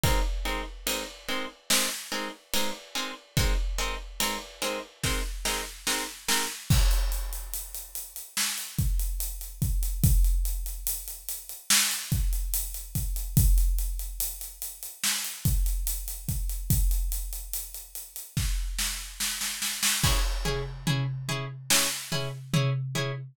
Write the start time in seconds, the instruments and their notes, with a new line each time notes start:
0.03 pizzicato strings G#3 C4 D#4 A#4, kick, ride
0.45 pizzicato strings G#3 C4 D#4 A#4, ride
0.87 pizzicato strings G#3 C4 D#4 A#4, ride
1.28 pizzicato strings G#3 C4 D#4 A#4, ride
1.70 pizzicato strings G#3 C4 D#4 A#4, snare
2.12 pizzicato strings G#3 C4 D#4 A#4, ride
2.53 pizzicato strings G#3 C4 D#4 A#4, ride
2.95 pizzicato strings G#3 C4 D#4 A#4, ride
3.37 pizzicato strings G#3 C4 D#4 A#4, kick, ride
3.78 pizzicato strings G#3 C4 D#4 A#4, ride
4.20 pizzicato strings G#3 C4 D#4 A#4, ride
4.62 pizzicato strings G#3 C4 D#4 A#4, ride
5.03 pizzicato strings G#3 C4 D#4 A#4, kick, snare
5.45 pizzicato strings G#3 C4 D#4 A#4, snare
5.87 pizzicato strings G#3 C4 D#4 A#4, snare
6.28 pizzicato strings G#3 C4 D#4 A#4, snare
6.70 kick, crash
6.91 closed hi-hat
7.12 closed hi-hat
7.33 closed hi-hat
7.53 closed hi-hat
7.74 closed hi-hat
7.95 closed hi-hat
8.16 closed hi-hat
8.37 snare
8.58 closed hi-hat
8.78 kick, closed hi-hat
8.99 closed hi-hat
9.20 closed hi-hat
9.41 closed hi-hat
9.62 kick, closed hi-hat
9.83 closed hi-hat
10.03 kick, closed hi-hat
10.24 closed hi-hat
10.45 closed hi-hat
10.66 closed hi-hat
10.87 closed hi-hat
11.08 closed hi-hat
11.28 closed hi-hat
11.49 closed hi-hat
11.70 snare
11.91 closed hi-hat
12.12 kick, closed hi-hat
12.33 closed hi-hat
12.54 closed hi-hat
12.74 closed hi-hat
12.95 kick, closed hi-hat
13.16 closed hi-hat
13.37 kick, closed hi-hat
13.58 closed hi-hat
13.78 closed hi-hat
13.99 closed hi-hat
14.20 closed hi-hat
14.41 closed hi-hat
14.62 closed hi-hat
14.83 closed hi-hat
15.03 snare
15.24 closed hi-hat
15.45 kick, closed hi-hat
15.66 closed hi-hat
15.87 closed hi-hat
16.08 closed hi-hat
16.28 kick, closed hi-hat
16.49 closed hi-hat
16.70 kick, closed hi-hat
16.91 closed hi-hat
17.12 closed hi-hat
17.33 closed hi-hat
17.53 closed hi-hat
17.74 closed hi-hat
17.95 closed hi-hat
18.16 closed hi-hat
18.37 kick, snare
18.78 snare
19.20 snare
19.41 snare
19.62 snare
19.83 snare
20.03 pizzicato strings C#4 E4 G#4, kick, crash
20.45 pizzicato strings C#4 E4 G#4, floor tom
20.87 pizzicato strings C#4 E4 G#4, floor tom
21.28 pizzicato strings C#4 E4 G#4, floor tom
21.70 pizzicato strings C#4 E4 G#4, snare
22.12 pizzicato strings C#4 E4 G#4, floor tom
22.53 pizzicato strings C#4 E4 G#4, floor tom
22.95 pizzicato strings C#4 E4 G#4, floor tom